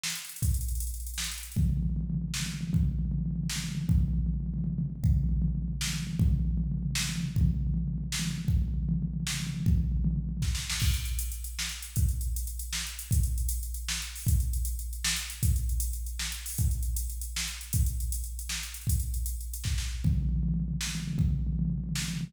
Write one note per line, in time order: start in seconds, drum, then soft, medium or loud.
0.03 snare loud
0.10 closed hi-hat medium
0.15 closed hi-hat medium
0.25 closed hi-hat medium
0.29 closed hi-hat medium
0.36 closed hi-hat medium
0.42 kick loud
0.42 closed hi-hat loud
0.49 closed hi-hat medium
0.54 closed hi-hat medium
0.61 closed hi-hat medium
0.68 closed hi-hat medium
0.75 closed hi-hat medium
0.80 closed hi-hat loud
0.87 closed hi-hat medium
0.94 closed hi-hat medium
1.00 closed hi-hat medium
1.07 closed hi-hat medium
1.14 closed hi-hat medium
1.18 snare loud
1.24 closed hi-hat medium
1.32 closed hi-hat medium
1.38 closed hi-hat medium
1.43 closed hi-hat medium
1.52 closed hi-hat medium
1.56 kick loud
1.56 floor tom loud
1.63 floor tom medium
1.69 floor tom medium
1.77 floor tom medium
1.83 floor tom medium
1.90 floor tom medium
1.96 floor tom loud
2.01 floor tom medium
2.10 floor tom medium
2.14 floor tom medium
2.22 floor tom medium
2.28 floor tom medium
2.34 snare loud
2.40 floor tom medium
2.46 floor tom medium
2.54 floor tom medium
2.61 floor tom medium
2.67 floor tom medium
2.73 kick loud
2.73 floor tom loud
2.81 floor tom medium
2.85 floor tom medium
2.91 floor tom medium
2.99 floor tom medium
3.05 floor tom medium
3.11 floor tom loud
3.19 floor tom medium
3.26 floor tom medium
3.31 floor tom medium
3.36 floor tom medium
3.43 floor tom medium
3.50 snare loud
3.56 floor tom medium
3.64 floor tom medium
3.69 floor tom medium
3.75 floor tom loud
3.82 floor tom medium
3.89 kick loud
3.89 floor tom loud
3.95 floor tom medium
4.01 floor tom loud
4.08 floor tom medium
4.13 floor tom medium
4.19 floor tom medium
4.26 floor tom loud
4.34 floor tom medium
4.40 floor tom medium
4.46 floor tom medium
4.54 floor tom medium
4.58 floor tom medium
4.64 floor tom loud
4.70 floor tom medium
4.78 floor tom loud
4.86 floor tom medium
4.90 floor tom medium
4.96 floor tom medium
5.04 kick loud
5.04 floor tom loud
5.08 floor tom medium
5.17 floor tom medium
5.24 floor tom medium
5.29 floor tom medium
5.37 floor tom medium
5.42 floor tom loud
5.48 floor tom medium
5.55 floor tom medium
5.62 floor tom medium
5.68 floor tom medium
5.73 floor tom medium
5.81 snare loud
5.87 floor tom medium
5.93 floor tom medium
6.00 floor tom medium
6.07 floor tom medium
6.13 floor tom medium
6.19 kick loud
6.19 floor tom loud
6.26 floor tom medium
6.31 floor tom medium
6.40 floor tom medium
6.45 floor tom medium
6.51 floor tom medium
6.57 floor tom loud
6.64 floor tom medium
6.72 floor tom medium
6.77 floor tom medium
6.83 floor tom medium
6.91 floor tom medium
6.95 snare loud
7.01 floor tom medium
7.09 floor tom medium
7.16 floor tom medium
7.20 floor tom medium
7.28 floor tom medium
7.36 kick loud
7.41 floor tom loud
7.46 floor tom medium
7.54 floor tom medium
7.61 floor tom medium
7.67 floor tom medium
7.74 floor tom loud
7.78 floor tom medium
7.88 floor tom medium
7.94 floor tom medium
7.98 floor tom medium
8.04 floor tom medium
8.12 snare loud
8.19 floor tom loud
8.25 floor tom medium
8.31 floor tom medium
8.38 floor tom medium
8.45 kick loud
8.45 floor tom medium
8.57 floor tom medium
8.62 floor tom medium
8.68 floor tom medium
8.74 floor tom medium
8.83 floor tom medium
8.89 floor tom loud
8.94 floor tom medium
9.02 floor tom medium
9.08 floor tom medium
9.14 floor tom medium
9.20 floor tom medium
9.27 snare loud
9.34 floor tom medium
9.40 floor tom medium
9.47 floor tom medium
9.54 floor tom medium
9.60 floor tom medium
9.66 kick loud
9.66 floor tom loud
9.71 floor tom medium
9.78 floor tom medium
9.84 floor tom medium
9.92 floor tom medium
9.97 floor tom medium
10.04 floor tom loud
10.11 floor tom medium
10.16 floor tom medium
10.24 floor tom medium
10.29 floor tom medium
10.37 floor tom medium
10.42 kick medium
10.42 snare medium
10.55 snare loud
10.70 snare loud
10.80 kick loud
10.80 crash loud
10.94 closed hi-hat medium
11.05 closed hi-hat medium
11.19 closed hi-hat loud
11.32 closed hi-hat medium
11.44 closed hi-hat medium
11.59 snare loud
11.69 closed hi-hat medium
11.83 closed hi-hat medium
11.96 kick loud
11.96 closed hi-hat loud
12.09 closed hi-hat medium
12.21 closed hi-hat medium
12.36 closed hi-hat loud
12.47 closed hi-hat medium
12.59 closed hi-hat medium
12.73 snare loud
12.87 closed hi-hat medium
12.99 closed hi-hat loud
13.11 kick loud
13.11 closed hi-hat loud
13.23 closed hi-hat medium
13.38 closed hi-hat medium
13.49 closed hi-hat loud
13.63 closed hi-hat medium
13.74 closed hi-hat medium
13.88 snare loud
14.02 closed hi-hat medium
14.15 open hi-hat medium
14.27 kick loud
14.27 closed hi-hat loud
14.40 closed hi-hat medium
14.53 closed hi-hat medium
14.65 closed hi-hat loud
14.79 closed hi-hat medium
14.93 closed hi-hat medium
15.04 snare loud
15.16 closed hi-hat medium
15.30 closed hi-hat medium
15.43 kick loud
15.43 closed hi-hat loud
15.56 closed hi-hat medium
15.69 closed hi-hat medium
15.80 closed hi-hat loud
15.93 closed hi-hat medium
16.06 closed hi-hat medium
16.19 snare loud
16.32 closed hi-hat medium
16.46 open hi-hat medium
16.58 kick loud
16.58 closed hi-hat loud
16.71 closed hi-hat medium
16.83 closed hi-hat medium
16.96 closed hi-hat loud
17.10 closed hi-hat medium
17.21 closed hi-hat medium
17.36 snare loud
17.47 closed hi-hat medium
17.61 closed hi-hat medium
17.73 kick loud
17.73 closed hi-hat loud
17.86 closed hi-hat medium
18.00 closed hi-hat medium
18.12 closed hi-hat loud
18.24 closed hi-hat medium
18.39 closed hi-hat medium
18.49 snare loud
18.63 closed hi-hat medium
18.74 closed hi-hat medium
18.81 closed hi-hat medium
18.87 kick loud
18.87 closed hi-hat loud
19.00 closed hi-hat medium
19.14 closed hi-hat medium
19.26 closed hi-hat loud
19.41 closed hi-hat medium
19.54 closed hi-hat loud
19.64 kick loud
19.64 snare medium
19.78 snare medium
20.04 kick loud
20.04 floor tom loud
20.10 floor tom medium
20.18 floor tom medium
20.22 floor tom medium
20.29 floor tom medium
20.36 floor tom medium
20.43 floor tom loud
20.48 floor tom medium
20.54 floor tom medium
20.60 floor tom medium
20.68 floor tom medium
20.74 floor tom medium
20.81 snare loud
20.87 floor tom medium
20.95 floor tom medium
21.00 floor tom medium
21.08 floor tom medium
21.13 floor tom medium
21.18 kick loud
21.18 floor tom loud
21.25 floor tom medium
21.31 floor tom medium
21.39 floor tom medium
21.47 floor tom medium
21.53 floor tom medium
21.59 floor tom loud
21.65 floor tom medium
21.70 floor tom medium
21.78 floor tom medium
21.84 floor tom medium
21.89 floor tom medium
21.95 snare loud
22.02 floor tom medium
22.08 floor tom medium
22.14 floor tom medium
22.21 floor tom loud
22.28 floor tom medium